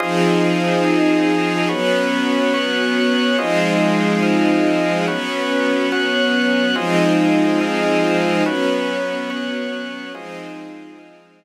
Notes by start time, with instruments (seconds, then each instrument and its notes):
0.00 string ensemble 1 F3 C4 D#4 G#4, drawbar organ F4 G#4 C5 D#5
0.85 drawbar organ F4 G#4 D#5 F5
1.69 string ensemble 1 F#3 B3 C#4, drawbar organ F#4 B4 C#5
2.54 drawbar organ F#4 C#5 F#5
3.38 string ensemble 1 F3 G#3 C4 D#4, drawbar organ F4 G#4 C5 D#5
4.23 drawbar organ F4 G#4 D#5 F5
5.07 string ensemble 1 F#3 B3 C#4, drawbar organ F#4 B4 C#5
5.92 drawbar organ F#4 C#5 F#5
6.75 string ensemble 1 F3 G#3 C4 D#4, drawbar organ F4 G#4 C5 D#5
7.61 drawbar organ F4 G#4 D#5 F5
8.45 string ensemble 1 F#3 B3 C#4, drawbar organ F#4 B4 C#5
9.30 drawbar organ F#4 C#5 F#5
10.14 string ensemble 1 F3 G#3 C4 D#4, drawbar organ F4 G#4 C5 D#5
10.99 drawbar organ F4 G#4 D#5 F5